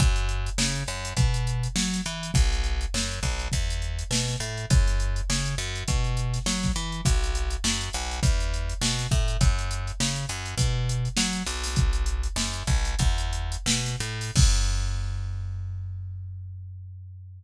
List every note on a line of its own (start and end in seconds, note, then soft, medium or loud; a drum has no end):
0.00 0.50 F#2 loud
0.00 kick loud
0.00 closed hi-hat medium
0.16 closed hi-hat medium
0.29 closed hi-hat medium
0.46 closed hi-hat medium
0.58 0.84 C#3 loud
0.58 snare loud
0.75 closed hi-hat medium
0.88 1.13 F#2 medium
0.88 closed hi-hat medium
1.05 closed hi-hat medium
1.17 1.68 B2 medium
1.17 kick medium
1.17 closed hi-hat medium
1.34 closed hi-hat medium
1.47 closed hi-hat medium
1.63 closed hi-hat medium
1.76 2.01 F#3 loud
1.76 snare loud
1.93 snare medium
1.93 closed hi-hat medium
2.06 2.31 E3 loud
2.06 closed hi-hat medium
2.23 closed hi-hat medium
2.34 2.86 B1 loud
2.34 kick loud
2.34 closed hi-hat medium
2.52 closed hi-hat medium
2.64 closed hi-hat medium
2.81 closed hi-hat medium
2.94 3.20 F#2 medium
2.94 snare loud
3.11 closed hi-hat medium
3.23 3.48 B1 medium
3.23 kick medium
3.23 closed hi-hat medium
3.39 closed hi-hat medium
3.52 4.04 E2 loud
3.52 kick medium
3.52 closed hi-hat medium
3.70 closed hi-hat medium
3.82 closed hi-hat medium
3.99 closed hi-hat medium
4.11 4.36 B2 medium
4.11 snare loud
4.28 snare medium
4.28 closed hi-hat medium
4.40 4.66 A2 loud
4.40 closed hi-hat medium
4.57 closed hi-hat medium
4.70 5.22 F#2 loud
4.70 kick loud
4.70 closed hi-hat loud
4.87 snare soft
4.87 closed hi-hat medium
5.00 closed hi-hat medium
5.16 closed hi-hat medium
5.30 5.55 C#3 loud
5.30 snare loud
5.45 closed hi-hat medium
5.58 5.84 F#2 loud
5.58 closed hi-hat medium
5.75 closed hi-hat medium
5.88 6.39 B2 medium
5.88 kick medium
5.88 closed hi-hat medium
6.04 closed hi-hat medium
6.17 closed hi-hat medium
6.34 snare soft
6.34 closed hi-hat medium
6.46 6.72 F#3 loud
6.46 snare loud
6.63 kick medium
6.63 snare medium
6.63 closed hi-hat medium
6.76 7.01 E3 loud
6.76 closed hi-hat medium
6.92 closed hi-hat medium
7.05 7.56 B1 loud
7.05 kick medium
7.05 closed hi-hat loud
7.24 closed hi-hat medium
7.35 closed hi-hat medium
7.50 closed hi-hat medium
7.64 7.90 F#2 loud
7.64 snare loud
7.81 closed hi-hat medium
7.93 8.20 B1 loud
7.93 closed hi-hat medium
8.11 closed hi-hat medium
8.23 8.74 E2 loud
8.23 kick medium
8.23 closed hi-hat medium
8.40 closed hi-hat medium
8.54 closed hi-hat medium
8.69 closed hi-hat medium
8.81 9.07 B2 loud
8.81 snare loud
8.99 snare medium
8.99 closed hi-hat medium
9.11 9.37 A2 loud
9.11 kick medium
9.11 closed hi-hat medium
9.28 closed hi-hat medium
9.41 9.92 F#2 loud
9.41 kick loud
9.41 closed hi-hat loud
9.58 closed hi-hat medium
9.71 closed hi-hat medium
9.87 closed hi-hat medium
10.00 10.26 C#3 loud
10.00 snare loud
10.16 closed hi-hat medium
10.29 10.55 F#2 medium
10.29 closed hi-hat medium
10.46 closed hi-hat medium
10.58 11.09 B2 loud
10.58 kick medium
10.58 closed hi-hat loud
10.89 closed hi-hat medium
11.05 closed hi-hat medium
11.17 11.43 F#3 medium
11.17 snare loud
11.33 snare soft
11.33 closed hi-hat medium
11.46 12.28 B1 loud
11.46 closed hi-hat medium
11.64 snare soft
11.64 open hi-hat medium
11.76 kick loud
11.76 closed hi-hat medium
11.93 closed hi-hat medium
12.06 closed hi-hat medium
12.23 closed hi-hat medium
12.36 12.63 F#2 medium
12.36 snare loud
12.53 closed hi-hat medium
12.67 12.95 B1 medium
12.67 kick medium
12.67 closed hi-hat medium
12.85 closed hi-hat medium
12.99 13.57 E2 loud
12.99 kick medium
12.99 closed hi-hat medium
13.18 closed hi-hat medium
13.33 closed hi-hat medium
13.52 closed hi-hat medium
13.66 13.96 B2 medium
13.66 snare loud
13.85 snare medium
13.85 closed hi-hat medium
14.00 14.31 A2 loud
14.00 closed hi-hat medium
14.21 open hi-hat medium
14.36 17.43 F#2 loud
14.36 kick loud
14.36 crash loud